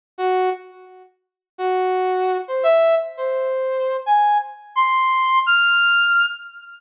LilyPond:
\new Staff { \time 9/8 \tempo 4. = 113 r8 fis'4 r2. | fis'2~ fis'8 c''8 e''4 r8 | c''2~ c''8 gis''4 r4 | c'''2 f'''2~ f'''8 | }